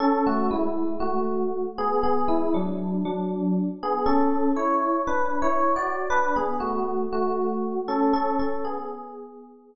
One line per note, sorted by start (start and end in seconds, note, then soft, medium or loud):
0.00 0.24 C#4 medium
0.00 0.24 A4 loud
0.26 0.51 A3 medium
0.26 0.51 F#4 medium
0.51 0.94 G#3 medium
0.51 0.94 E4 medium
1.00 1.62 A3 medium
1.00 1.62 F#4 medium
1.78 2.02 B3 medium
1.78 2.02 G#4 loud
2.03 2.28 B3 medium
2.03 2.28 G#4 medium
2.28 2.52 G#3 medium
2.28 2.52 E4 medium
2.54 3.03 F#3 medium
2.54 3.03 D4 medium
3.05 3.68 F#3 medium
3.05 3.68 D4 medium
3.83 4.07 B3 medium
3.83 4.07 G#4 medium
4.06 4.49 C#4 medium
4.06 4.49 A4 loud
4.56 5.01 E4 medium
4.56 5.01 C#5 medium
5.07 5.39 D4 medium
5.07 5.39 B4 medium
5.42 5.74 E4 medium
5.42 5.74 C#5 medium
5.76 6.08 F#4 medium
5.76 6.08 D5 medium
6.10 6.34 D4 medium
6.10 6.34 B4 loud
6.36 6.60 B3 medium
6.36 6.60 G#4 medium
6.60 7.05 A3 medium
6.60 7.05 F#4 medium
7.12 7.78 A3 medium
7.12 7.78 F#4 medium
7.88 8.12 C#4 medium
7.88 8.12 A4 medium
8.13 8.37 C#4 medium
8.13 8.37 A4 loud
8.39 8.64 C#4 medium
8.39 8.64 A4 medium
8.65 9.75 B3 medium
8.65 9.75 G#4 medium